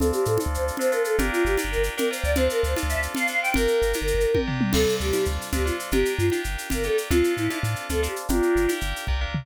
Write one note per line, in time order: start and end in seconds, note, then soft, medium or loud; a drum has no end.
0.00 0.12 D2 loud
0.00 0.36 C4 loud
0.00 0.36 D4 loud
0.00 0.36 F4 loud
0.00 0.11 A4 loud
0.00 0.36 A4 medium
0.00 low conga loud
0.00 shaker medium
0.13 0.25 G4 loud
0.13 shaker medium
0.25 0.38 A2 medium
0.25 0.38 A4 medium
0.25 shaker medium
0.38 0.76 C4 medium
0.38 0.76 D4 medium
0.38 0.76 F4 medium
0.38 0.76 A4 medium
0.38 high conga medium
0.38 shaker medium
0.46 0.58 D2 medium
0.53 0.64 C5 loud
0.53 shaker medium
0.59 0.71 D2 medium
0.68 shaker medium
0.77 0.91 C4 medium
0.77 0.91 D4 medium
0.77 0.91 F4 medium
0.77 0.91 A4 medium
0.77 0.91 C5 loud
0.77 low conga medium
0.77 shaker medium
0.92 1.16 C4 medium
0.92 1.16 D4 medium
0.92 1.16 F4 medium
0.92 1.16 A4 medium
0.92 1.02 A#4 medium
0.92 shaker medium
1.04 1.16 A4 medium
1.04 shaker medium
1.18 1.30 G1 loud
1.18 1.55 D4 loud
1.18 1.55 F4 medium
1.18 1.55 G4 medium
1.18 1.31 G4 loud
1.18 1.55 A#4 loud
1.18 low conga loud
1.18 shaker medium
1.31 1.43 F4 loud
1.31 shaker medium
1.45 1.57 G1 medium
1.45 1.56 G4 loud
1.45 shaker medium
1.57 1.94 D4 medium
1.57 1.94 F4 medium
1.57 1.94 G4 medium
1.57 1.94 A#4 medium
1.57 high conga medium
1.57 shaker medium
1.64 1.76 G1 medium
1.71 1.83 A#4 loud
1.71 shaker medium
1.78 1.89 G1 medium
1.83 shaker medium
1.97 2.09 D4 medium
1.97 2.09 F4 medium
1.97 2.09 G4 medium
1.97 2.09 A#4 medium
1.97 2.08 A#4 medium
1.97 low conga medium
1.97 shaker medium
2.11 2.35 D4 medium
2.11 2.35 F4 medium
2.11 2.35 G4 medium
2.11 2.35 A#4 medium
2.11 2.21 C5 loud
2.11 shaker medium
2.24 2.49 D2 medium
2.24 2.34 D5 medium
2.24 shaker medium
2.35 2.73 C4 loud
2.35 2.73 D4 medium
2.35 2.73 F4 medium
2.35 2.73 A4 medium
2.35 2.48 C5 loud
2.35 low conga loud
2.35 shaker medium
2.50 2.61 A#4 loud
2.50 shaker medium
2.63 2.75 D2 medium
2.63 2.74 C5 loud
2.63 shaker medium
2.76 3.13 C4 medium
2.76 3.13 D4 medium
2.76 3.13 F4 medium
2.76 3.13 A4 medium
2.76 high conga medium
2.76 shaker medium
2.83 2.95 D2 medium
2.89 3.00 E5 medium
2.89 shaker medium
2.96 3.08 D2 medium
3.03 shaker medium
3.15 3.28 C4 medium
3.15 3.28 D4 medium
3.15 3.28 F4 medium
3.15 3.28 A4 medium
3.15 3.27 F5 loud
3.15 low conga medium
3.15 shaker medium
3.27 3.53 C4 medium
3.27 3.53 D4 medium
3.27 3.53 F4 medium
3.27 3.53 A4 medium
3.27 3.40 F5 loud
3.27 shaker medium
3.42 3.53 G5 loud
3.42 shaker medium
3.54 3.67 G1 loud
3.54 3.92 D4 medium
3.54 3.92 F4 loud
3.54 3.92 G4 medium
3.54 4.39 A#4 loud
3.54 3.92 A#4 loud
3.54 low conga loud
3.54 shaker medium
3.68 shaker medium
3.82 3.94 G1 medium
3.82 shaker medium
3.93 4.31 D4 medium
3.93 4.31 F4 medium
3.93 4.31 G4 medium
3.93 4.31 A#4 medium
3.93 high conga medium
3.93 shaker medium
4.01 4.13 G1 medium
4.07 shaker medium
4.14 4.26 G1 medium
4.20 shaker medium
4.34 4.46 D4 medium
4.34 4.46 F4 medium
4.34 4.46 G4 medium
4.34 4.46 A#4 medium
4.34 kick medium
4.34 high tom medium
4.47 4.72 D4 medium
4.47 4.72 F4 medium
4.47 4.72 G4 medium
4.47 4.72 A#4 medium
4.47 floor tom medium
4.61 mid tom loud
4.73 4.86 D2 loud
4.73 5.10 C4 medium
4.73 5.10 D4 medium
4.73 5.10 F4 medium
4.73 4.95 A4 loud
4.73 5.10 A4 medium
4.73 crash loud
4.73 low conga loud
4.73 shaker medium
4.89 shaker medium
5.00 5.12 D2 medium
5.00 5.25 G4 medium
5.00 shaker medium
5.13 5.49 C4 medium
5.13 5.49 D4 medium
5.13 5.49 F4 medium
5.13 5.49 A4 medium
5.13 high conga medium
5.13 shaker medium
5.25 5.38 D2 loud
5.25 shaker medium
5.41 shaker medium
5.52 5.58 D2 medium
5.52 5.65 C4 medium
5.52 5.65 D4 medium
5.52 5.65 F4 medium
5.52 5.64 G4 loud
5.52 5.65 A4 medium
5.52 low conga medium
5.52 shaker medium
5.59 5.71 D2 medium
5.66 5.90 C4 medium
5.66 5.90 D4 medium
5.66 5.77 F4 medium
5.66 5.90 F4 medium
5.66 5.90 A4 medium
5.66 shaker medium
5.79 shaker medium
5.91 6.04 G1 loud
5.91 6.29 D4 medium
5.91 6.29 F4 medium
5.91 6.29 G4 medium
5.91 6.14 G4 loud
5.91 6.29 A#4 medium
5.91 low conga loud
5.91 shaker medium
6.05 shaker medium
6.18 6.30 G2 medium
6.18 6.41 F4 loud
6.18 shaker medium
6.30 6.68 D4 medium
6.30 6.68 F4 medium
6.30 6.68 G4 medium
6.30 6.68 A#4 medium
6.30 high conga medium
6.30 shaker medium
6.44 6.57 G1 medium
6.44 shaker medium
6.58 shaker medium
6.70 6.77 G1 medium
6.70 6.83 D4 medium
6.70 6.83 F4 medium
6.70 6.83 G4 medium
6.70 6.83 A#4 medium
6.70 low conga medium
6.70 shaker medium
6.78 6.89 G1 medium
6.83 7.08 D4 medium
6.83 7.08 F4 medium
6.83 7.08 G4 medium
6.83 6.97 A4 loud
6.83 7.08 A#4 medium
6.83 shaker medium
6.98 shaker medium
7.10 7.22 D2 loud
7.10 7.47 C4 loud
7.10 7.47 D4 medium
7.10 7.47 F4 medium
7.10 7.34 F4 loud
7.10 7.47 A4 medium
7.10 low conga loud
7.10 shaker medium
7.24 shaker medium
7.37 7.49 A2 medium
7.37 7.59 E4 loud
7.37 shaker medium
7.50 7.87 C4 medium
7.50 7.87 D4 medium
7.50 7.87 F4 medium
7.50 7.87 A4 medium
7.50 high conga medium
7.50 shaker medium
7.63 7.75 A2 medium
7.63 shaker medium
7.76 shaker medium
7.89 7.95 D2 medium
7.89 8.02 C4 medium
7.89 8.02 D4 medium
7.89 8.02 F4 medium
7.89 8.01 A4 loud
7.89 8.02 A4 medium
7.89 low conga medium
7.89 shaker medium
7.96 8.08 D2 medium
8.03 8.27 C4 medium
8.03 8.27 D4 medium
8.03 8.27 F4 medium
8.03 8.14 G4 loud
8.03 8.27 A4 medium
8.03 shaker medium
8.16 shaker medium
8.29 8.41 G1 loud
8.29 8.65 D4 loud
8.29 8.65 F4 medium
8.29 8.72 F4 loud
8.29 8.65 G4 loud
8.29 8.65 A#4 medium
8.29 low conga loud
8.29 shaker medium
8.42 shaker medium
8.55 8.67 G1 medium
8.55 shaker medium
8.68 9.05 D4 medium
8.68 9.05 F4 medium
8.68 9.05 G4 medium
8.68 9.05 A#4 medium
8.68 high conga medium
8.68 shaker medium
8.81 8.94 G1 medium
8.81 shaker medium
8.96 shaker medium
9.07 9.26 C2 medium
9.07 9.20 D4 medium
9.07 9.20 F4 medium
9.07 9.20 G4 medium
9.07 9.20 A#4 medium
9.07 kick medium
9.21 9.45 D4 medium
9.21 9.45 F4 medium
9.21 9.45 G4 medium
9.21 9.45 A#4 medium
9.28 9.45 C#2 medium
9.34 floor tom loud